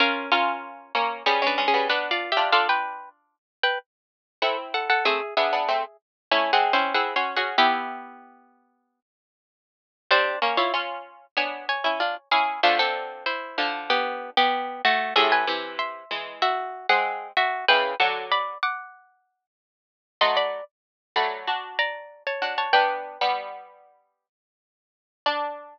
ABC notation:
X:1
M:4/4
L:1/16
Q:1/4=95
K:Bm
V:1 name="Pizzicato Strings"
[C^A]2 [CA]4 z2 (3[C_A]2 [DB]2 [CA]2 (3[DB]2 [=Fd]2 [Ge]2 | [A=f] [Bg]3 z3 [Bg] z4 [A^f] z [Af] [Af] | [^Ge]2 [Ge]4 z2 (3[Ec]2 [Gf]2 [C^B]2 (3[Gf]2 [c^b]2 [Gf]2 | [B,G]10 z6 |
[D^B]2 z [^Ec] z4 [c_a]2 [ca]4 [_A=f]2 | [A,=F] [=CA]3 [E=c]4 [B,G]3 [B,G]3 [A,^F]2 | [^Ge] [B^g]3 [e=c']4 [Fe]3 [Gf]3 [Fe]2 | [Bg]2 [Af]2 [db]2 [fd']6 z4 |
[K:D] [_e=c'] [db]2 z3 [db]4 [d_b]3 [^ca]2 [ca] | [Bg]12 z4 | d16 |]
V:2 name="Pizzicato Strings"
[C^E]2 [CE]4 [^A,C]2 [G,B,] [_A,C] [A,C] [G,B,] [B,D]3 [D=F] | [D=F]6 z6 [=CE]4 | [A,=C] z [B,D] [B,D] [A,C] z3 (3[A,^C]2 [^G,^B,]2 [B,E]2 (3[B,E]2 [CF]2 [CF]2 | [EG]8 z8 |
[G,^B,]2 [^A,C] E [C^E]4 [=B,D]3 [C=E] [D=F] z [CE]2 | [D,=F,]6 [D,F,]6 z4 | [A,,=C,]2 [C,E,]4 [E,^G,]5 [G,^B,]3 z2 | [C,E,]2 [D,F,]4 z10 |
[K:D] [F,A,]3 z3 [F,A,]2 [DF]6 [DF]2 | [B,D]3 [G,B,]7 z6 | D16 |]